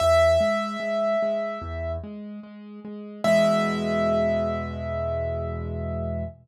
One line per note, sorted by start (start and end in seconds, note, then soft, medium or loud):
0.00 0.38 E2 medium
0.00 1.92 E5 loud
0.40 0.77 G#3 medium
0.80 1.16 G#3 medium
1.22 1.59 G#3 medium
1.62 1.98 E2 medium
2.04 2.40 G#3 medium
2.43 2.80 G#3 medium
2.85 3.21 G#3 medium
3.24 6.24 E2 loud
3.24 6.24 B2 medium
3.24 6.24 G#3 loud
3.24 6.24 E5 loud